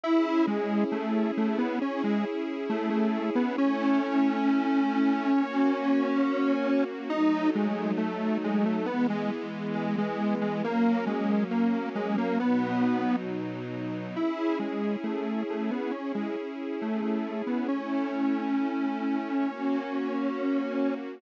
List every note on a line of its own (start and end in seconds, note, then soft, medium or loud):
0.03 1.80 C#4 medium
0.03 0.46 E4 loud
0.03 1.80 E4 medium
0.03 1.80 G#4 medium
0.47 0.84 G#3 medium
0.92 1.31 A3 medium
1.37 1.58 A3 medium
1.58 1.79 B3 medium
1.81 3.55 C#4 medium
1.81 2.02 C#4 medium
1.81 3.55 E4 medium
1.81 3.55 G#4 medium
2.04 2.25 G#3 medium
2.69 2.89 A3 medium
2.90 3.30 A3 medium
3.35 3.56 B3 medium
3.57 5.32 A3 loud
3.57 5.32 C#4 medium
3.57 6.84 C#4 loud
3.57 5.32 E4 medium
5.34 7.09 A#3 medium
5.34 7.09 C#4 medium
5.34 7.09 F#4 medium
7.10 8.85 F#3 medium
7.10 8.85 A3 medium
7.10 7.50 D#4 loud
7.10 8.85 D#4 medium
7.55 7.92 G#3 medium
7.97 8.38 A3 medium
8.44 8.65 G#3 medium
8.65 8.86 A3 medium
8.86 10.62 E3 medium
8.86 10.62 G#3 loud
8.86 9.07 B3 loud
8.86 10.62 B3 medium
9.10 9.31 G#3 medium
9.75 9.96 G#3 medium
9.98 10.35 G#3 loud
10.42 10.63 G#3 medium
10.63 12.38 F#3 medium
10.63 12.38 A#3 medium
10.63 11.05 A#3 loud
10.63 12.38 C#4 medium
11.06 11.44 G#3 medium
11.51 11.89 A#3 medium
11.95 12.16 G#3 loud
12.18 12.39 A#3 loud
12.40 14.15 B2 medium
12.40 14.15 F#3 medium
12.40 13.16 B3 loud
12.40 14.15 D#4 medium
14.16 15.91 C#4 medium
14.16 14.58 E4 medium
14.16 15.91 E4 medium
14.16 15.91 G#4 medium
14.59 14.96 G#3 medium
15.03 15.43 A3 medium
15.50 15.71 A3 medium
15.71 15.92 B3 medium
15.91 16.12 C#4 medium
15.91 17.67 C#4 medium
15.91 17.67 E4 medium
15.91 17.67 G#4 medium
16.15 16.36 G#3 medium
16.82 17.01 A3 medium
17.02 17.42 A3 medium
17.47 17.68 B3 medium
17.68 19.44 A3 medium
17.68 20.94 C#4 medium
17.68 19.44 C#4 medium
17.68 19.44 E4 medium
19.45 21.20 A#3 medium
19.45 21.20 C#4 medium
19.45 21.20 F#4 medium